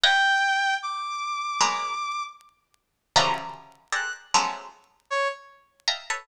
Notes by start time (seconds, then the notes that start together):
0.04 B4 C#5 D#5 F5 G5
0.82 D6
1.61 F#3 G#3 A#3 B3
3.16 C#3 D3 E3 F3 F#3 G3
3.92 G4 G#4 A4 A#4 C5 D5 F#6
4.34 F3 F#3 G#3 A3 B3 C#4
5.10 C#5
5.88 D#5 E5 F5 G5 A5 A#5
6.10 A4 B4 C#5